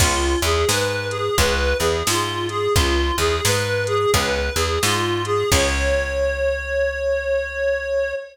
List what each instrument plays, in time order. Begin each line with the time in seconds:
0.00 electric bass (finger) C#2, acoustic guitar (steel) B3 C#4 F4 G#4, clarinet F4, kick, crash
0.42 electric bass (finger) E2, acoustic guitar (steel) E3, clarinet G#4, closed hi-hat
0.69 electric bass (finger) G#2, acoustic guitar (steel) G#3, clarinet B4, snare
1.10 clarinet G#4, closed hi-hat
1.38 electric bass (finger) C#2, acoustic guitar (steel) B3 C#4 F4 G#4, clarinet B4, kick, closed hi-hat
1.79 electric bass (finger) E2, acoustic guitar (steel) E3, clarinet G#4, closed hi-hat
2.07 electric bass (finger) G#2, acoustic guitar (steel) G#3, clarinet F4, snare
2.49 clarinet G#4, closed hi-hat
2.74 electric bass (finger) C#2, acoustic guitar (steel) B3 C#4 F4 G#4, clarinet F4, kick, closed hi-hat
3.18 electric bass (finger) E2, acoustic guitar (steel) E3, clarinet G#4, closed hi-hat
3.45 electric bass (finger) G#2, acoustic guitar (steel) G#3, clarinet B4, snare
3.86 clarinet G#4, closed hi-hat
4.14 electric bass (finger) C#2, acoustic guitar (steel) B3 C#4 F4 G#4, clarinet B4, kick, closed hi-hat
4.55 electric bass (finger) E2, acoustic guitar (steel) E3, clarinet G#4, closed hi-hat
4.83 electric bass (finger) G#2, acoustic guitar (steel) G#3, clarinet F4, snare
5.25 clarinet G#4, closed hi-hat
5.51 electric bass (finger) C#2, acoustic guitar (steel) B3 C#4 F4 G#4, clarinet C#5, kick, crash